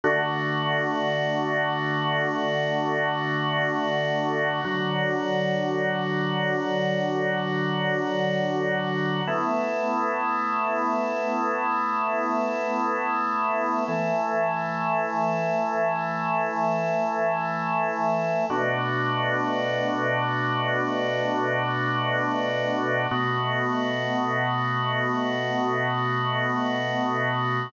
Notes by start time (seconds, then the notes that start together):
0.04 D3 A3 F#4
4.65 D3 F#3 F#4
9.27 A3 B3 E4
13.88 E3 A3 E4
18.50 B2 A3 D4 F#4
23.11 B2 A3 B3 F#4